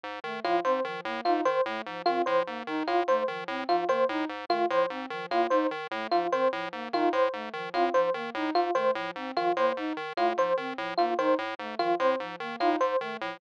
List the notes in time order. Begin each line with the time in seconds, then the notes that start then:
0.03 G#2
0.24 D#3 A3
0.44 A2 F3 F4
0.64 G#2 C4 C5
0.84 D#3 F3
1.05 A2 A#3
1.25 G#2 D#4 F4
1.45 D#3 C5
1.66 A2 A3
1.86 G#2 F3
2.06 D#3 C4 F4
2.26 A2 F3 C5
2.46 G#2 A#3
2.67 D#3 D#4
2.87 A2 F4
3.08 G#2 A3 C5
3.28 D#3 F3
3.48 A2 C4
3.68 G#2 F3 F4
3.89 D#3 A#3 C5
4.09 A2 D#4
4.29 G#2
4.49 D#3 A3 F4
4.70 A2 F3 C5
4.90 G#2 C4
5.10 D#3 F3
5.30 A2 A#3 F4
5.50 G#2 D#4 C5
5.71 D#3
5.91 A2 A3
6.11 G#2 F3 F4
6.32 D#3 C4 C5
6.52 A2 F3
6.72 G#2 A#3
6.93 D#3 D#4 F4
7.13 A2 C5
7.33 G#2 A3
7.53 D#3 F3
7.74 A2 C4 F4
7.94 G#2 F3 C5
8.14 D#3 A#3
8.34 A2 D#4
8.55 G#2 F4
8.75 D#3 A3 C5
8.95 A2 F3
9.16 G#2 C4
9.36 D#3 F3 F4
9.57 A2 A#3 C5
9.76 G#2 D#4
9.97 D#3
10.17 A2 A3 F4
10.37 G#2 F3 C5
10.57 D#3 C4
10.78 A2 F3
10.97 G#2 A#3 F4
11.18 D#3 D#4 C5
11.38 A2
11.59 G#2 A3
11.79 D#3 F3 F4
11.99 A2 C4 C5
12.20 G#2 F3
12.40 D#3 A#3
12.60 A2 D#4 F4
12.80 G#2 C5
13.01 D#3 A3
13.21 A2 F3